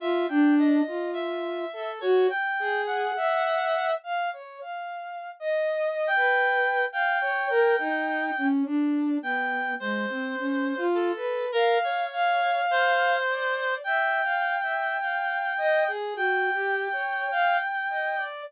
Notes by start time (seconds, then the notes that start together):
0.00 F4 E5
0.28 D4 G5
0.59 D#5
0.87 F4
1.13 E5
1.73 A4
2.01 F#4 C#5
2.29 G5
2.60 G#4
2.87 F#5
3.16 E5
4.03 F5
4.33 C#5
4.61 F5
5.40 D#5
6.07 G5
6.15 B4
6.92 F5 G5
7.21 C#5
7.50 A#4
7.79 D#4
8.37 C#4
8.65 D4
9.22 B3 G5
9.80 G#3 C5
10.09 C4
10.38 C#4
10.77 F4
10.94 A4
11.16 B4
11.52 A#4 F5
11.84 C#5
12.12 F5
12.71 C5
13.28 D5
13.84 E5 G5
14.23 F5
14.62 E5
15.00 F5
15.58 D#5
15.88 G#4
16.15 F#4 G5
16.53 G4
16.92 C#5
17.31 F5
17.89 D#5
18.17 D5